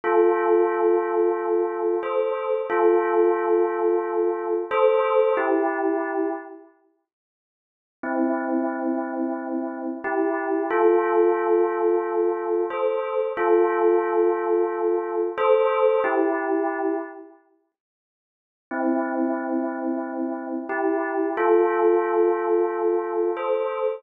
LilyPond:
\new Staff { \time 4/4 \key c \mixolydian \tempo 4 = 90 <f' a'>2. <a' c''>4 | <f' a'>2. <a' c''>4 | <e' g'>4. r2 r8 | <c' e'>2. <e' g'>4 |
<f' a'>2. <a' c''>4 | <f' a'>2. <a' c''>4 | <e' g'>4. r2 r8 | <c' e'>2. <e' g'>4 |
<f' a'>2. <a' c''>4 | }